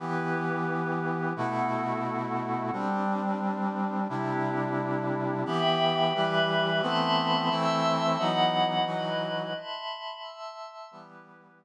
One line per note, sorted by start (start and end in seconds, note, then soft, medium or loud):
0.00 1.33 E3 medium
0.00 1.33 B3 medium
0.00 1.35 E4 medium
0.00 1.33 G4 medium
0.00 1.35 G4 medium
0.00 1.35 B4 medium
1.36 2.71 B2 medium
1.36 2.71 A3 medium
1.36 2.71 B3 medium
1.36 2.71 E4 medium
1.36 2.71 E4 soft
1.36 2.71 F#4 medium
1.36 2.71 A4 medium
2.72 4.07 G3 medium
2.72 4.08 G3 medium
2.72 4.07 C4 medium
2.72 4.08 C4 medium
2.72 4.07 D4 medium
2.72 4.08 D4 medium
4.09 5.44 C3 medium
4.09 5.44 G3 medium
4.09 5.44 C4 medium
4.09 5.44 D4 medium
4.09 5.44 E4 medium
4.09 5.44 G4 medium
5.46 6.13 E3 medium
5.46 6.13 B3 medium
5.46 6.13 G4 medium
5.46 6.12 E5 medium
5.46 6.14 G5 medium
5.46 6.12 B5 medium
6.13 6.81 E3 medium
6.13 6.82 G3 medium
6.13 6.82 G4 medium
6.13 6.80 B4 medium
6.13 6.80 E5 medium
6.13 6.80 B5 medium
6.82 7.49 E3 medium
6.82 7.49 A3 medium
6.82 7.49 B3 medium
6.82 7.49 C4 medium
6.82 7.49 E5 medium
6.82 7.49 A5 medium
6.82 7.49 B5 medium
6.82 7.49 C6 medium
7.50 8.18 E3 medium
7.50 8.18 A3 medium
7.50 8.18 C4 medium
7.50 8.18 E4 medium
7.50 8.18 E5 medium
7.50 8.18 A5 medium
7.50 8.18 C6 medium
7.50 8.18 E6 medium
8.17 8.85 E3 medium
8.17 8.85 F#3 medium
8.17 8.87 B3 medium
8.17 8.85 D#4 medium
8.17 8.85 E4 medium
8.17 8.85 D#5 medium
8.17 8.85 F#5 medium
8.17 8.85 B5 medium
8.86 9.53 E3 medium
8.86 9.53 F#3 medium
8.86 9.53 D#4 medium
8.86 9.54 E4 medium
8.86 9.53 F#4 medium
8.86 9.54 B4 medium
8.86 9.54 D#5 medium
8.86 9.54 B5 medium
9.55 10.22 E5 medium
9.55 10.22 A5 medium
9.55 10.22 B5 medium
9.55 10.22 C6 medium
10.23 10.90 E5 medium
10.23 10.90 A5 medium
10.23 10.90 C6 medium
10.23 10.90 E6 medium
10.91 11.65 E3 medium
10.91 11.65 G3 medium
10.91 11.65 B3 medium
10.91 11.58 E4 medium
10.91 11.59 G4 medium
10.91 11.58 B4 medium
11.59 11.65 B3 medium
11.59 11.65 E4 medium
11.59 11.65 B4 medium